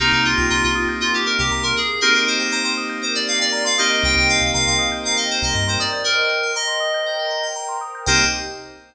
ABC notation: X:1
M:4/4
L:1/16
Q:1/4=119
K:Cm
V:1 name="Electric Piano 2"
E E F2 F F2 z F G B G2 B A2 | B B c2 c c2 z c d f d2 f e2 | g g f2 f f2 z f e c e2 c d2 | B4 e8 z4 |
c4 z12 |]
V:2 name="Electric Piano 2"
[B,CEG]16 | [B,CEG]14 [B,CEG]2- | [B,CEG]16 | z16 |
[B,CEG]4 z12 |]
V:3 name="Tubular Bells"
B c e g b c' e' g' B c e g b c' B2- | B c e g b c' e' g' B c e g b c' e' g' | B c e g b c' e' g' B c e g b c' e' g' | B c e g b c' e' g' B c e g b c' e' g' |
[Bceg]4 z12 |]
V:4 name="Synth Bass 1" clef=bass
C,, C,,2 C,, C,, C,,6 C,, C,,4 | z16 | C,, C,,2 C,, C,, C,,6 C,, G,,4 | z16 |
C,,4 z12 |]
V:5 name="Pad 2 (warm)"
[B,CEG]8 [B,CGB]8 | [B,CEG]8 [B,CGB]8 | [Bceg]8 [Bcgb]8 | [Bceg]8 [Bcgb]8 |
[B,CEG]4 z12 |]